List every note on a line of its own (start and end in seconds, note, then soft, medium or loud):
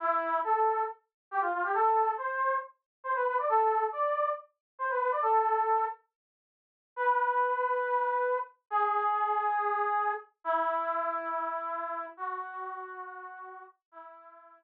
0.00 0.39 E4 medium
0.44 0.83 A4 medium
1.31 1.41 G4 medium
1.40 1.51 F4 medium
1.52 1.63 F4 medium
1.63 1.73 G4 medium
1.74 2.11 A4 medium
2.17 2.56 C5 medium
3.04 3.14 C5 medium
3.15 3.25 B4 medium
3.26 3.36 B4 medium
3.38 3.48 D5 medium
3.49 3.85 A4 medium
3.92 4.29 D5 medium
4.78 4.88 C5 medium
4.90 4.99 B4 medium
5.00 5.10 B4 medium
5.11 5.21 D5 medium
5.22 5.85 A4 medium
6.96 8.36 B4 medium
8.70 10.12 G#4 medium
10.44 12.06 E4 medium
12.17 13.62 F#4 medium
13.91 14.61 E4 medium